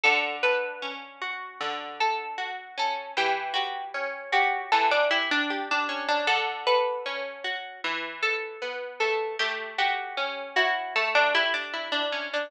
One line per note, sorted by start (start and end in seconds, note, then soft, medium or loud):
0.03 1.60 D3 loud
0.03 0.36 A4 loud
0.43 3.03 A4 medium
0.43 1.45 B4 loud
0.82 2.77 C#4 medium
1.22 2.37 F#4 medium
1.61 3.09 D3 medium
2.00 2.75 A4 loud
2.38 3.12 F#4 medium
2.78 3.15 C#4 medium
2.78 3.11 A4 loud
3.17 4.72 E3 loud
3.17 3.53 G4 loud
3.54 4.24 F#4 loud
3.54 4.32 G4 medium
3.94 5.88 C#4 medium
4.32 4.70 F#4 loud
4.32 5.10 G4 medium
4.72 6.21 E3 medium
4.72 4.90 A4 loud
4.91 5.10 D4 loud
5.11 5.29 E4 loud
5.11 5.50 G4 medium
5.31 5.69 D4 loud
5.50 6.24 G4 medium
5.71 6.07 D4 loud
5.89 6.26 C#4 medium
6.08 6.27 D4 loud
6.27 7.75 D3 loud
6.27 6.65 A4 loud
6.67 7.78 A4 medium
6.67 7.74 B4 loud
7.06 7.80 C#4 medium
7.44 7.81 F#4 medium
7.84 9.32 E3 loud
8.22 8.96 A4 loud
8.62 9.36 B3 medium
9.00 9.38 A3 medium
9.00 9.35 A4 loud
9.39 10.95 A3 medium
9.39 9.75 G4 loud
9.78 10.47 F#4 medium
9.78 11.34 G4 medium
10.17 12.12 C#4 medium
10.56 11.73 E4 medium
10.56 10.94 F#4 loud
10.96 12.44 A3 medium
10.96 11.14 A4 loud
11.15 11.33 D4 loud
11.34 11.53 E4 loud
11.34 12.45 G4 medium
11.54 11.88 D4 medium
11.74 12.48 E4 medium
11.92 12.28 D4 loud
12.12 12.49 C#4 medium
12.33 12.51 D4 loud